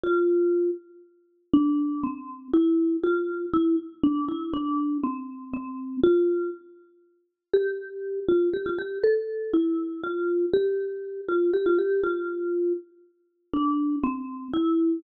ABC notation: X:1
M:6/8
L:1/16
Q:3/8=80
K:F
V:1 name="Marimba"
F6 z6 | [K:Dm] D4 C4 E4 | F4 E2 z2 D2 E2 | D4 C4 C4 |
F4 z8 | [K:F] G6 F2 G F G2 | A4 E4 F4 | G6 F2 G F G2 |
F6 z6 | [K:Dm] D4 C4 E4 |]